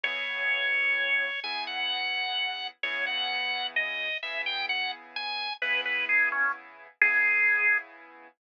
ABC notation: X:1
M:12/8
L:1/8
Q:3/8=86
K:C#m
V:1 name="Drawbar Organ"
c6 g f5 | c f3 d2 e =g f z ^g2 | B B G C z2 G4 z2 |]
V:2 name="Acoustic Grand Piano"
[C,B,EG]6 [C,B,EG]6 | [C,B,EG]6 [C,B,EG]6 | [C,B,EG]6 [C,B,EG]6 |]